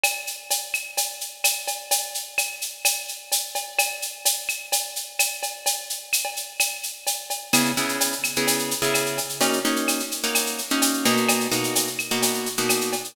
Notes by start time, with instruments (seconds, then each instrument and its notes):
0.04 cowbell, claves, shaker
0.27 shaker
0.50 cowbell, shaker
0.74 claves, shaker
0.97 cowbell, shaker
1.21 shaker
1.44 cowbell, claves, shaker
1.68 cowbell, shaker
1.91 cowbell, shaker
2.14 shaker
2.38 cowbell, claves, shaker
2.62 shaker
2.85 cowbell, claves, shaker
3.08 shaker
3.32 cowbell, shaker
3.55 cowbell, shaker
3.79 cowbell, claves, shaker
4.02 shaker
4.25 cowbell, shaker
4.49 claves, shaker
4.72 cowbell, shaker
4.96 shaker
5.19 cowbell, claves, shaker
5.43 cowbell, shaker
5.66 cowbell, shaker
5.90 shaker
6.13 claves, shaker
6.25 cowbell
6.37 shaker
6.60 cowbell, claves, shaker
6.83 shaker
7.07 cowbell, shaker
7.30 cowbell, shaker
7.53 acoustic guitar (steel) C#3 B3 E4 G#4, cowbell, claves, shaker
7.65 shaker
7.77 acoustic guitar (steel) C#3 B3 E4 G#4, shaker
7.89 shaker
8.00 cowbell, shaker
8.12 shaker
8.24 claves, shaker
8.36 acoustic guitar (steel) C#3 B3 E4 G#4, shaker
8.47 cowbell, shaker
8.59 shaker
8.71 shaker
8.82 acoustic guitar (steel) C#3 B3 E4 G#4, shaker
8.94 cowbell, claves, shaker
9.06 shaker
9.18 cowbell, shaker
9.29 shaker
9.41 acoustic guitar (steel) A#3 C#4 D#4 F#4, cowbell, shaker
9.53 shaker
9.65 acoustic guitar (steel) A#3 C#4 D#4 F#4, shaker
9.76 shaker
9.88 cowbell, claves, shaker
10.00 shaker
10.11 shaker
10.23 acoustic guitar (steel) A#3 C#4 D#4 F#4, shaker
10.35 cowbell, claves, shaker
10.46 shaker
10.58 shaker
10.70 acoustic guitar (steel) A#3 C#4 D#4 F#4, shaker
10.82 cowbell, shaker
10.93 shaker
11.05 acoustic guitar (steel) B2 A#3 D#4 F#4, cowbell, shaker
11.17 shaker
11.29 cowbell, claves, shaker
11.40 shaker
11.51 acoustic guitar (steel) B2 A#3 D#4 F#4, shaker
11.64 shaker
11.75 cowbell, shaker
11.87 shaker
11.99 claves, shaker
12.11 acoustic guitar (steel) B2 A#3 D#4 F#4, shaker
12.22 cowbell, shaker
12.34 shaker
12.46 shaker
12.57 acoustic guitar (steel) B2 A#3 D#4 F#4, shaker
12.69 cowbell, claves, shaker
12.81 shaker
12.93 cowbell, shaker
13.04 shaker